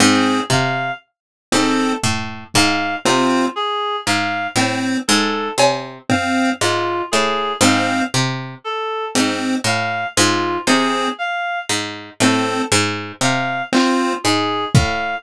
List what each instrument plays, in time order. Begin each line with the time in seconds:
0.00 harpsichord G#2, lead 1 (square) C4, clarinet G#4
0.50 harpsichord C3, clarinet F5, kick
1.52 harpsichord G#2, lead 1 (square) C4, clarinet A4
2.03 harpsichord A2, floor tom
2.54 harpsichord G#2, clarinet F5, kick
3.05 harpsichord C3, lead 1 (square) C4, clarinet F4
3.56 clarinet G#4
4.06 harpsichord G#2, clarinet F5
4.56 harpsichord A2, lead 1 (square) C4
5.08 harpsichord G#2, clarinet A4
5.58 harpsichord C3, cowbell
6.09 lead 1 (square) C4, clarinet F5, floor tom
6.61 harpsichord G#2, clarinet F4
7.11 harpsichord A2, clarinet G#4
7.61 harpsichord G#2, lead 1 (square) C4, clarinet F5
8.14 harpsichord C3
8.64 clarinet A4
9.15 harpsichord G#2, lead 1 (square) C4, closed hi-hat
9.64 harpsichord A2, clarinet F5
10.17 harpsichord G#2, clarinet F4
10.67 harpsichord C3, lead 1 (square) C4, clarinet G#4
11.18 clarinet F5
11.69 harpsichord G#2
12.20 harpsichord A2, lead 1 (square) C4, clarinet A4
12.72 harpsichord G#2
13.21 harpsichord C3, clarinet F5, closed hi-hat
13.72 lead 1 (square) C4, clarinet F4, clap
14.24 harpsichord G#2, clarinet G#4
14.75 harpsichord A2, clarinet F5, kick